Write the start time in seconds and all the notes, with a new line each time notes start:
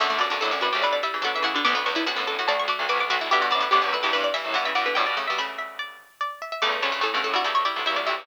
0.00 F#2 B2 D3 A3 E5
0.10 B2 D3 A3
0.18 F#2 G2 B2 D3 D5
0.30 F#2 D3 D4
0.41 F#2 A2 D3 E4 A4
0.51 D2 F#2 D3
0.61 F#2 A2 F#4 B4
0.73 D2 F#2 C#3 A3 G4
0.82 B2 D3 G3 E4 B4 D5
0.93 D5
1.03 G3 E4 E5
1.14 C#3 E3
1.22 B2 D3 F#3 D4 A4 F#5
1.35 C#3 E3 E5
1.42 C#3 E3 A3 E4 F#5
1.54 B2 D3 D4
1.65 B1 D2 D3 B3 D6
1.75 B1 D2 B3
1.86 C#2 E2 D3 B3 C#6
1.95 D3 B3 E4
2.06 D2 F#2 D3 B3 F#4 F#5
2.16 F#2 A2 D3 B3
2.27 D2 F#2 A4 A5
2.39 F#2 A2 A3 F#4 F#5
2.48 B1 D2 A3 F#4 D5 A5
2.59 C#6
2.68 A3 F#4 D6
2.79 B1 D2
2.89 B1 D2 A3 F#4 B4 D6
3.00 B1 D2 D6
3.10 B1 D2 A3 F#4 D6
3.21 B1 D2 E4
3.31 G2 B2 D3 B3 G4 E5
3.41 G2 B2 F#4
3.51 F#2 A2 D3 B3 D5
3.60 D3 B3 B4
3.71 D2 F#2 D3 B3 G4 D5
3.82 C#2 E2 D3 B3
3.93 D2 F#2 B4 E5
4.03 C#2 E2 G2 E3 G4
4.13 E2 G2 E3 B4 E5
4.24 D5
4.34 G2 E3 E5
4.44 F#2 A2
4.54 G2 B2 E3 E5 F#5
4.65 C#3 E3 E5
4.75 G2 B2 E3 D5 F#5
4.86 B2 D3 B4
4.95 F#2 A2 B2 G3 D5 G5
5.06 G2 B2 D5
5.17 C#3 A3
5.27 B2 G3 E5
5.38 C#3 A3 E5 B5
5.58 E5
5.79 D5
6.21 D5
6.42 E5
6.52 E5
6.62 C#2 E2 C#3 A3 D5
6.72 C#2 E2
6.82 D2 F#2 C#3 A3 A4 C#5
6.92 C#3 A3
7.01 F#2 A2 C#3 A3 A4
7.14 G2 B2 C#3 A3
7.24 F#2 A2 A4
7.34 G2 B2 G3 E4 F#4
7.44 C#2 E2 G3 E4 A4
7.55 C#5
7.65 G3 E4 D5
7.76 B1 D2
7.86 C#2 E2 G3 E4 E5
7.96 B1 D2 D5
8.06 B1 D2 G3 E4 E5
8.18 C#2 E2